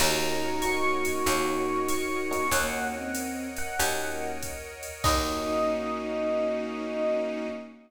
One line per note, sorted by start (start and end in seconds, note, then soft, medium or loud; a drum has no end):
0.00 1.07 D#2 loud
0.00 0.51 A#3 medium
0.00 0.51 C#4 medium
0.00 2.46 D#4 loud
0.00 0.51 D#4 loud
0.00 2.46 F#4 loud
0.00 0.51 F#4 loud
0.00 1.24 A#4 medium
0.00 1.24 C#5 medium
0.00 1.24 D#5 medium
0.00 1.24 F#5 medium
0.00 0.62 A#5 loud
0.00 crash loud
0.00 ride loud
0.62 1.15 A#3 medium
0.62 1.15 C#4 medium
0.62 1.15 D#4 medium
0.62 1.15 F#4 medium
0.62 1.83 C#6 loud
0.62 hi-hat pedal medium
0.62 ride medium
1.05 ride medium
1.26 2.35 D#2 loud
1.26 1.77 A#3 medium
1.26 1.77 C#4 medium
1.26 1.77 D#4 loud
1.26 1.77 F#4 loud
1.26 2.51 A#4 medium
1.26 2.51 C#5 medium
1.26 2.51 D#5 medium
1.26 2.51 F#5 medium
1.26 ride loud
1.88 2.48 C#6 medium
1.88 hi-hat pedal medium
1.88 ride medium
2.31 2.46 A#3 medium
2.31 2.46 C#4 medium
2.31 2.46 D#4 medium
2.31 2.46 F#4 medium
2.31 ride medium
2.51 3.60 D#2 loud
2.51 3.02 A#3 loud
2.51 2.92 A#3 loud
2.51 3.02 C#4 loud
2.51 3.02 D#4 medium
2.51 3.02 F#4 medium
2.51 3.77 A#4 medium
2.51 3.77 C#5 medium
2.51 3.77 D#5 medium
2.51 3.77 F#5 medium
2.51 3.38 F#5 loud
2.51 kick medium
2.51 ride loud
2.94 3.48 C4 medium
3.15 hi-hat pedal medium
3.15 ride medium
3.56 4.31 F#5 medium
3.56 ride medium
3.78 4.88 D#2 loud
3.78 4.29 A#3 medium
3.78 4.29 C#4 medium
3.78 4.29 D#4 loud
3.78 4.29 F#4 medium
3.78 5.03 A#4 medium
3.78 5.03 C#5 medium
3.78 5.03 D#5 medium
3.78 5.03 F#5 medium
3.78 ride loud
4.43 kick medium
4.43 hi-hat pedal medium
4.43 ride medium
4.83 ride medium
5.04 7.48 D#2 loud
5.04 7.46 A#3 loud
5.04 7.48 A#3 loud
5.04 7.46 C#4 medium
5.04 7.48 C#4 loud
5.04 7.46 D#4 loud
5.04 7.48 D#4 loud
5.04 7.46 F#4 medium
5.04 7.48 F#4 medium
5.04 7.46 D#5 loud
5.04 kick loud
5.04 crash loud